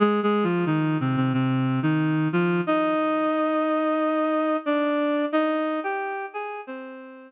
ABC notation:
X:1
M:4/4
L:1/16
Q:1/4=90
K:Fdor
V:1 name="Clarinet"
(3[A,A]2 [A,A]2 [F,F]2 [E,E]2 [C,C] [C,C] [C,C]3 [E,E]3 [F,F]2 | [Ee]12 [Dd]4 | [Ee]3 [Gg]3 [Aa]2 [Cc]4 z4 |]